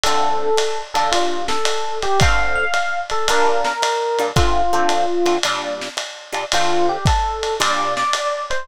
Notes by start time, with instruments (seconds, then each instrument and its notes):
0.03 acoustic guitar (steel) D3 A3 C4 F4, electric piano 1 A4, ride
0.57 hi-hat pedal, ride
0.94 acoustic guitar (steel) A#2 G3 D4 F4, electric piano 1 A4, ride
1.12 electric piano 1 F4, ride
1.48 electric piano 1 A4, snare
1.65 hi-hat pedal, ride
2.02 electric piano 1 G4, ride
2.20 acoustic guitar (steel) D3 A3 C4 F4, electric piano 1 F5, kick, ride
2.55 electric piano 1 F5
2.74 hi-hat pedal, ride
3.10 electric piano 1 A4, ride
3.28 acoustic guitar (steel) A#2 G3 D4 F4, electric piano 1 A#4, ride
3.64 electric piano 1 A#4, snare
3.82 hi-hat pedal, ride
4.19 acoustic guitar (steel) A#2 G3 D4 F4, ride
4.36 acoustic guitar (steel) D3 A3 C4 F4, electric piano 1 F4, kick, ride
4.73 acoustic guitar (steel) D3 A3 C4 F4
4.89 hi-hat pedal, ride
5.26 acoustic guitar (steel) D3 A3 C4 F4, ride
5.43 acoustic guitar (steel) A#2 G3 D4 F4, ride
5.81 snare
5.97 hi-hat pedal, ride
6.33 acoustic guitar (steel) A#2 G3 D4 F4, ride
6.52 acoustic guitar (steel) D3 A3 C4 F4, electric piano 1 F4, ride
6.89 electric piano 1 G4
7.05 electric piano 1 A4, kick, hi-hat pedal, ride
7.43 ride
7.60 acoustic guitar (steel) A#2 G3 D4 F4, electric piano 1 D5, ride
7.97 electric piano 1 D5, snare
8.13 hi-hat pedal, ride
8.50 electric piano 1 C5, ride